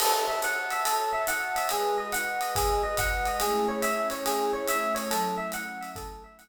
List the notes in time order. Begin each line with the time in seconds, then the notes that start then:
0.00 F#4 A4 C#5 E5 A5, crash, ride
0.28 E5
0.42 F#5, hi-hat pedal, ride
0.70 E5, ride
0.85 A4, ride
1.13 E5
1.27 F#5, hi-hat pedal, ride
1.56 E5, ride
1.69 G#3 F#4 G#4 B4 D#5, ride
1.98 D#5
2.12 F#5, hi-hat pedal, ride
2.41 D#5, ride
2.55 G#4, kick, ride
2.83 D#5
2.97 F#5, kick, hi-hat pedal, ride
3.26 D#5, ride
3.40 A3 C#4 E4 G#4, ride
3.68 C#5
3.82 E5, hi-hat pedal, ride
4.10 C#5, ride
4.26 G#4, ride
4.53 C#5
4.68 E5, hi-hat pedal, ride
4.95 C#5, ride
5.11 F#3 A3 C#4 E4 A4, ride
5.38 E5
5.52 F#5, hi-hat pedal, ride
5.81 E5, ride
5.95 A4, kick, ride
6.24 E5
6.39 F#5, hi-hat pedal, ride